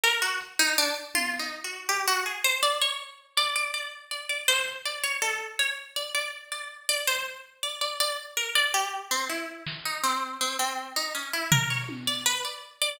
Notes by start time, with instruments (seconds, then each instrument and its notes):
0.04 harpsichord A#4, closed hi-hat
0.22 harpsichord F#4
0.41 closed hi-hat
0.59 harpsichord D#4
0.78 harpsichord D4
1.15 harpsichord F4, high tom
1.39 harpsichord D#4
1.64 harpsichord F#4
1.89 harpsichord G4, cowbell
2.07 harpsichord F#4
2.26 harpsichord G#4
2.44 harpsichord C5
2.63 harpsichord D5
2.81 harpsichord C#5
3.37 harpsichord D5, closed hi-hat
3.56 harpsichord D5
3.74 harpsichord D5
4.11 harpsichord D5
4.29 harpsichord D5
4.48 harpsichord C5, clap
4.85 harpsichord D5
5.03 harpsichord C#5
5.22 harpsichord A4, cowbell
5.59 harpsichord C#5
5.96 harpsichord D5
6.15 harpsichord D5
6.52 harpsichord D5
6.89 harpsichord D5
7.07 harpsichord C5, clap
7.63 harpsichord D5
7.81 harpsichord D5
8.00 harpsichord D5
8.37 harpsichord A#4
8.55 harpsichord D5, closed hi-hat
8.74 harpsichord G4
9.11 harpsichord C4
9.29 harpsichord E4
9.67 snare
9.85 harpsichord D#4
10.03 harpsichord C4
10.41 harpsichord C4
10.59 harpsichord C4
10.96 harpsichord D#4
11.15 harpsichord C#4
11.33 harpsichord E4
11.52 harpsichord A#4, floor tom
11.70 harpsichord C#5
11.89 high tom
12.07 harpsichord D5
12.26 harpsichord B4
12.45 harpsichord D5
12.81 harpsichord D5